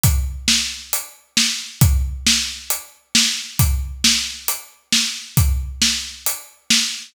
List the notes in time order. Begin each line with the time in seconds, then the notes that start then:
0.04 kick, closed hi-hat
0.48 snare
0.93 closed hi-hat
1.37 snare
1.81 kick, closed hi-hat
2.27 snare
2.70 closed hi-hat
3.15 snare
3.59 kick, closed hi-hat
4.04 snare
4.48 closed hi-hat
4.92 snare
5.37 kick, closed hi-hat
5.82 snare
6.26 closed hi-hat
6.70 snare